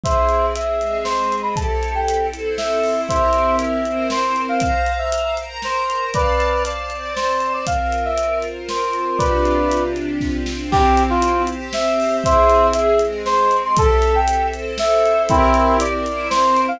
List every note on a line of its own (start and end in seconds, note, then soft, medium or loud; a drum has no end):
0.03 0.79 C4 medium
0.03 0.79 E4 medium
0.03 0.79 G#4 medium
0.03 0.46 C5 medium
0.03 0.46 E5 medium
0.03 kick loud
0.03 closed hi-hat loud
0.29 closed hi-hat medium
0.55 0.99 E5 medium
0.55 closed hi-hat loud
0.80 1.56 G#3 medium
0.80 1.55 C4 medium
0.80 1.56 G#4 medium
0.80 closed hi-hat medium
1.04 1.35 C5 medium
1.04 snare loud
1.32 closed hi-hat medium
1.42 1.54 B5 medium
1.56 2.31 C4 medium
1.56 2.31 E4 medium
1.56 2.31 G4 medium
1.56 2.31 A4 medium
1.56 1.92 A5 loud
1.56 kick loud
1.56 closed hi-hat loud
1.83 closed hi-hat medium
1.95 2.27 G5 medium
2.08 closed hi-hat loud
2.33 3.09 C4 medium
2.33 3.09 E4 medium
2.33 3.09 A4 medium
2.33 3.09 C5 medium
2.33 closed hi-hat medium
2.58 3.01 E5 medium
2.58 snare loud
2.84 open hi-hat medium
3.09 3.85 C4 medium
3.09 3.85 E4 medium
3.09 3.85 G4 medium
3.09 3.85 A#4 medium
3.09 3.56 C5 medium
3.09 3.56 E5 loud
3.09 kick loud
3.09 closed hi-hat loud
3.33 closed hi-hat medium
3.59 4.07 E5 medium
3.59 closed hi-hat loud
3.85 4.60 C4 medium
3.85 4.60 E4 medium
3.85 4.60 A#4 medium
3.85 4.60 C5 medium
3.85 closed hi-hat medium
4.10 4.41 C5 medium
4.10 snare loud
4.36 closed hi-hat medium
4.49 4.61 F5 medium
4.60 5.37 C5 medium
4.60 4.92 F5 loud
4.60 5.37 F5 medium
4.60 5.37 A#5 medium
4.60 kick loud
4.60 closed hi-hat loud
4.86 closed hi-hat medium
4.99 5.35 E5 medium
5.12 closed hi-hat loud
5.37 6.14 A#4 medium
5.37 6.14 C5 medium
5.37 6.14 A#5 medium
5.37 closed hi-hat medium
5.62 6.05 C5 medium
5.62 snare loud
5.90 closed hi-hat medium
6.14 6.90 C4 medium
6.14 6.63 B4 medium
6.14 6.90 D5 medium
6.14 6.63 D5 loud
6.14 6.90 F5 medium
6.14 6.90 A5 medium
6.14 kick loud
6.14 closed hi-hat loud
6.40 closed hi-hat medium
6.65 7.14 D5 medium
6.65 closed hi-hat loud
6.90 7.66 C4 medium
6.90 7.66 C5 medium
6.90 7.66 D5 medium
6.90 7.66 A5 medium
6.90 closed hi-hat medium
7.16 7.53 C5 medium
7.16 snare loud
7.40 closed hi-hat medium
7.53 7.65 D5 medium
7.67 9.18 C4 medium
7.67 9.18 F4 medium
7.67 9.18 A#4 medium
7.67 8.04 F5 medium
7.67 kick loud
7.67 closed hi-hat loud
7.92 closed hi-hat medium
8.05 8.39 E5 medium
8.18 closed hi-hat loud
8.42 closed hi-hat medium
8.69 9.18 C5 medium
8.69 snare loud
8.93 closed hi-hat medium
9.18 10.70 C3 loud
9.18 10.70 D4 medium
9.18 10.70 F4 medium
9.18 10.70 G4 medium
9.18 9.83 B4 medium
9.18 9.83 D5 medium
9.18 kick loud
9.18 closed hi-hat loud
9.45 closed hi-hat medium
9.72 closed hi-hat loud
9.96 closed hi-hat medium
10.20 kick medium
10.20 snare medium
10.46 snare loud
10.71 11.47 C4 loud
10.71 11.47 E4 loud
10.71 11.47 G4 loud
10.71 11.03 G4 loud
10.71 kick loud
10.71 crash loud
10.97 closed hi-hat loud
11.10 11.43 F4 loud
11.22 closed hi-hat loud
11.47 12.23 C4 loud
11.47 12.24 G4 loud
11.47 12.24 C5 loud
11.47 closed hi-hat medium
11.73 12.17 E5 loud
11.73 snare loud
12.00 open hi-hat medium
12.24 12.99 C4 loud
12.24 12.99 E4 medium
12.24 12.99 G#4 loud
12.24 12.67 C5 loud
12.24 12.67 E5 loud
12.24 kick loud
12.24 closed hi-hat loud
12.50 closed hi-hat medium
12.73 13.00 E5 loud
12.73 closed hi-hat loud
12.99 13.76 G#3 loud
12.99 13.76 C4 loud
12.99 13.76 G#4 medium
12.99 closed hi-hat medium
13.26 13.56 C5 loud
13.26 snare loud
13.51 closed hi-hat medium
13.64 13.76 C6 loud
13.77 14.51 C4 medium
13.77 14.51 E4 medium
13.77 14.52 G4 loud
13.77 14.51 A4 medium
13.77 14.14 A4 loud
13.77 kick loud
13.77 closed hi-hat loud
14.02 closed hi-hat medium
14.15 14.47 G5 loud
14.28 closed hi-hat loud
14.52 15.27 C4 medium
14.52 15.27 E4 medium
14.52 15.27 A4 loud
14.52 15.27 C5 medium
14.52 closed hi-hat medium
14.78 15.22 E5 loud
14.78 snare loud
15.06 closed hi-hat medium
15.29 15.77 C4 loud
15.29 16.05 C4 medium
15.29 15.77 E4 loud
15.29 16.05 E4 loud
15.29 16.05 G4 medium
15.29 16.05 A#4 loud
15.29 kick loud
15.29 closed hi-hat loud
15.54 closed hi-hat medium
15.80 16.28 D5 loud
15.80 closed hi-hat loud
16.06 16.80 C4 loud
16.06 16.80 E4 medium
16.06 16.80 A#4 loud
16.06 16.80 C5 loud
16.06 closed hi-hat medium
16.30 16.61 C5 loud
16.30 snare loud
16.57 closed hi-hat medium
16.68 16.80 F5 loud